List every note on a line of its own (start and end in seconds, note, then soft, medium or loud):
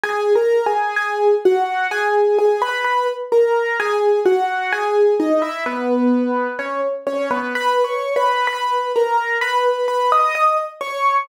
0.04 0.33 G#4 loud
0.04 0.33 G#5 loud
0.35 0.65 A#4 medium
0.35 0.65 A#5 loud
0.66 0.96 G#4 medium
0.66 0.96 G#5 medium
0.96 1.35 G#4 medium
0.96 1.35 G#5 medium
1.45 1.87 F#4 medium
1.45 1.87 F#5 loud
1.91 2.37 G#4 loud
1.91 2.37 G#5 loud
2.38 2.61 G#4 medium
2.38 2.61 G#5 loud
2.62 2.84 B4 loud
2.62 2.84 B5 loud
2.84 3.07 B4 medium
2.84 3.07 B5 loud
3.32 3.77 A#4 medium
3.32 3.77 A#5 medium
3.80 4.20 G#4 loud
3.80 4.20 G#5 loud
4.26 4.71 F#4 medium
4.26 4.71 F#5 loud
4.72 5.14 G#4 loud
4.72 5.14 G#5 loud
5.20 5.42 D#4 medium
5.20 5.42 D#5 loud
5.42 5.64 E4 medium
5.42 5.64 E5 loud
5.66 6.47 B3 medium
5.66 6.47 B4 loud
6.59 6.81 C#4 medium
6.59 6.81 C#5 medium
7.07 7.29 C#4 medium
7.07 7.29 C#5 loud
7.31 7.53 B3 loud
7.31 7.53 B4 loud
7.55 7.85 B4 loud
7.55 7.85 B5 loud
7.84 8.14 C#5 medium
7.84 8.14 C#6 medium
8.16 8.46 B4 medium
8.16 8.46 B5 loud
8.47 8.92 B4 medium
8.47 8.92 B5 loud
8.96 9.37 A#4 medium
8.96 9.37 A#5 medium
9.41 9.87 B4 medium
9.41 9.87 B5 loud
9.88 10.10 B4 medium
9.88 10.10 B5 loud
10.12 10.34 D#5 medium
10.12 10.34 D#6 loud
10.35 10.57 D#5 medium
10.35 10.57 D#6 loud
10.81 11.19 C#5 medium
10.81 11.19 C#6 loud